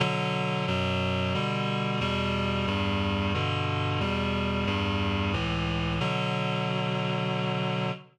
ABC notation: X:1
M:3/4
L:1/8
Q:1/4=90
K:Bm
V:1 name="Clarinet" clef=bass
[B,,D,F,]2 [F,,B,,F,]2 [B,,D,G,]2 | [E,,B,,G,]2 [E,,G,,G,]2 [G,,B,,D,]2 | [E,,B,,G,]2 [E,,G,,G,]2 [C,,A,,E,]2 | [B,,D,F,]6 |]